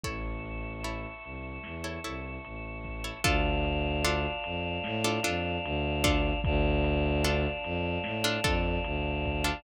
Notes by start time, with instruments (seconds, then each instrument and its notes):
0.04 violin A1, pizzicato strings E4 A4 C#5, choir aahs E5 A5 C#6, kick, closed hi-hat
0.45 closed hi-hat
0.84 pizzicato strings E4 A4 C#5, closed hi-hat
1.24 violin C2, closed hi-hat
1.64 violin E2, snare
1.84 pizzicato strings E4 A4 C#5
2.04 violin C2, pizzicato strings E4 A4 C#5, closed hi-hat
2.44 violin A1, closed hi-hat
2.84 kick, closed hi-hat
3.04 pizzicato strings E4 A4 C#5
3.24 violin D2, pizzicato strings D4 F4 A4, choir aahs D5 F5 A5, kick, closed hi-hat
3.65 closed hi-hat
4.04 pizzicato strings D4 F4 A4, closed hi-hat
4.44 violin F2, closed hi-hat
4.84 violin A2, snare
5.04 pizzicato strings D4 F4 A4
5.23 violin F2, pizzicato strings D4 F4 A4, closed hi-hat
5.64 violin D2, closed hi-hat
6.04 pizzicato strings D4 F4 A4, kick, closed hi-hat
6.44 violin D2, choir aahs D5 F5 A5, kick, closed hi-hat
6.84 closed hi-hat
7.25 pizzicato strings D4 F4 A4, closed hi-hat
7.64 violin F2, closed hi-hat
8.04 violin A2, snare
8.24 pizzicato strings D4 F4 A4
8.44 violin F2, pizzicato strings D4 F4 A4, kick, closed hi-hat
8.84 violin D2, closed hi-hat
9.25 kick, closed hi-hat
9.44 pizzicato strings D4 F4 A4